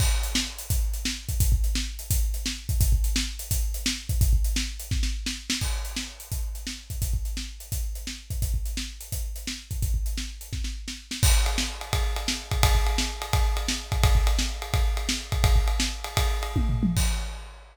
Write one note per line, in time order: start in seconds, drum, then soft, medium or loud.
0.00 kick loud
0.00 crash loud
0.23 closed hi-hat medium
0.35 snare loud
0.58 closed hi-hat medium
0.70 kick loud
0.70 closed hi-hat loud
0.94 closed hi-hat medium
1.05 snare loud
1.29 kick medium
1.29 closed hi-hat medium
1.40 kick loud
1.40 closed hi-hat loud
1.52 kick loud
1.64 closed hi-hat medium
1.75 snare loud
1.99 closed hi-hat medium
2.11 kick loud
2.11 closed hi-hat loud
2.34 closed hi-hat medium
2.46 snare loud
2.69 kick loud
2.69 closed hi-hat medium
2.81 kick loud
2.81 closed hi-hat loud
2.92 kick medium
3.04 closed hi-hat medium
3.16 snare loud
3.39 closed hi-hat medium
3.51 kick loud
3.51 closed hi-hat loud
3.74 closed hi-hat medium
3.86 snare loud
4.09 kick loud
4.09 closed hi-hat medium
4.21 kick loud
4.21 closed hi-hat loud
4.33 kick medium
4.44 closed hi-hat medium
4.56 snare loud
4.80 closed hi-hat medium
4.91 kick loud
4.91 snare medium
5.03 snare medium
5.26 snare loud
5.50 snare loud
5.61 kick medium
5.61 crash medium
5.85 closed hi-hat medium
5.96 snare loud
6.20 closed hi-hat medium
6.32 kick medium
6.32 closed hi-hat medium
6.55 closed hi-hat medium
6.67 snare loud
6.90 kick medium
6.90 closed hi-hat medium
7.02 kick medium
7.02 closed hi-hat loud
7.14 kick medium
7.25 closed hi-hat medium
7.37 snare medium
7.60 closed hi-hat medium
7.72 kick medium
7.72 closed hi-hat loud
7.95 closed hi-hat medium
8.07 snare medium
8.30 kick medium
8.30 closed hi-hat medium
8.42 kick medium
8.42 closed hi-hat medium
8.54 kick medium
8.65 closed hi-hat medium
8.77 snare loud
9.01 closed hi-hat medium
9.12 kick medium
9.12 closed hi-hat loud
9.36 closed hi-hat medium
9.47 snare loud
9.71 kick medium
9.71 closed hi-hat medium
9.82 kick loud
9.82 closed hi-hat medium
9.94 kick medium
10.06 closed hi-hat medium
10.18 snare loud
10.41 closed hi-hat medium
10.53 kick medium
10.53 snare medium
10.64 snare medium
10.88 snare medium
11.11 snare loud
11.23 kick loud
11.23 crash loud
11.46 ride medium
11.58 snare loud
11.81 ride medium
11.93 kick loud
11.93 ride loud
12.16 ride medium
12.28 snare loud
12.51 kick loud
12.51 ride medium
12.63 kick loud
12.63 ride loud
12.75 kick medium
12.87 ride medium
12.98 snare loud
13.22 ride medium
13.33 kick loud
13.33 ride loud
13.57 ride medium
13.68 snare loud
13.92 kick loud
13.92 ride medium
14.04 kick loud
14.04 ride loud
14.15 kick loud
14.27 ride loud
14.39 snare loud
14.62 ride medium
14.74 kick loud
14.74 ride loud
14.97 ride medium
15.09 snare loud
15.32 kick loud
15.32 ride medium
15.44 kick loud
15.44 ride loud
15.56 kick medium
15.68 ride medium
15.80 snare loud
16.04 ride medium
16.17 kick loud
16.17 ride loud
16.43 ride medium
16.56 kick loud
16.56 high tom medium
16.69 floor tom loud
16.83 mid tom loud
16.97 kick loud
16.97 crash loud